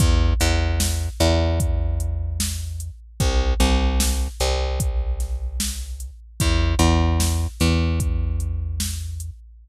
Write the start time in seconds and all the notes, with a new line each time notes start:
0.00 E2, kick, closed hi-hat
0.40 E2, closed hi-hat
0.80 snare
1.20 E2, closed hi-hat
1.60 kick, closed hi-hat
2.00 closed hi-hat
2.40 snare
2.80 closed hi-hat
3.20 C2, kick, closed hi-hat
3.60 C2, closed hi-hat
4.00 snare
4.40 C2, closed hi-hat
4.80 kick, closed hi-hat
5.20 snare, closed hi-hat
5.60 snare
6.00 closed hi-hat
6.40 E2, kick, closed hi-hat
6.79 E2, closed hi-hat
7.20 snare
7.60 E2, snare, closed hi-hat
8.00 kick, closed hi-hat
8.40 closed hi-hat
8.80 snare
9.20 closed hi-hat